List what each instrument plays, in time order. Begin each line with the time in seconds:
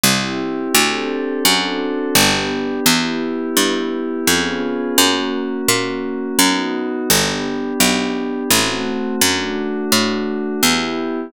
0.04 harpsichord C2, pad 5 (bowed) C4 E4 G4
0.74 harpsichord D2, pad 5 (bowed) C4 D4 G4 A4
1.45 harpsichord F#2, pad 5 (bowed) C4 D4 F#4 A4
2.15 harpsichord G1, pad 5 (bowed) B3 D4 G4
2.86 harpsichord E2, pad 5 (bowed) B3 E4 G4
3.57 harpsichord G2
4.27 harpsichord F2, pad 5 (bowed) B3 C#4 F4 G#4
4.98 harpsichord F#2, pad 5 (bowed) A#3 C#4 F#4
5.68 harpsichord A#2
6.39 harpsichord F#2, pad 5 (bowed) B3 D#4 F#4
7.10 harpsichord G1, pad 5 (bowed) B3 D4 G4
7.80 harpsichord B1
8.51 harpsichord A1, pad 5 (bowed) A3 C4 F#4
9.21 harpsichord F#2, pad 5 (bowed) A3 D4 F#4
9.92 harpsichord A2
10.62 harpsichord E2, pad 5 (bowed) B3 E4 G4